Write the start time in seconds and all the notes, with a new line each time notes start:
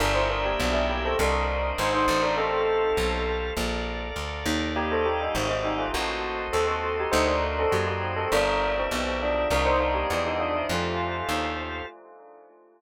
0.00 G1 D4 A#4 D5 E5 G5
0.14 E4 C5
0.30 D4 A#4
0.45 A#3 G4
0.60 B1 F3 D4
0.72 G3 E4
0.89 A#3 G4
1.05 C4 A4
1.19 C2 D4 A#4 C5 D5 D#5
1.78 G#1 D#4 C5
1.94 D#4 C5
2.08 A1
2.22 D4 A#4
2.37 C4 G4 A4 C5 F5
2.97 B1
3.56 A#1 A4 A#4 D5 F5
4.16 D2
4.46 D#2
4.75 A#3 G4 D5 D#5 F5
4.91 C4 A4
5.05 A#3 G4
5.21 G3 D#4
5.35 G#1 D#3 C4
5.49 D#3 C4
5.63 G3 D#4
5.78 A3 F4
5.93 A1 A#3 F#4 A4 C5 D#5
6.53 D#2 C4 A4
6.68 C4 A4
7.00 G4
7.12 D2 D#4 F#4 C5 D5 D#5
7.27 D4 A#4
7.59 C4 A4
7.72 F#2 A#3 G4
7.87 A#3 G4
8.16 C4 A4
8.32 G1 D4 G4 A#4 D5 E5
8.78 E3 C4
8.91 B1
9.22 F3 D4
9.50 C2 D4 A#4 C5 D5 D#5
9.65 D#4 C5
9.80 D4 A#4
9.94 A#3 G4
10.10 E2 F3 D4
10.26 G3 D#4
10.39 F3 D4
10.55 E4
10.69 F2 A3 F4 G4 A4 C5 F5
11.29 D#2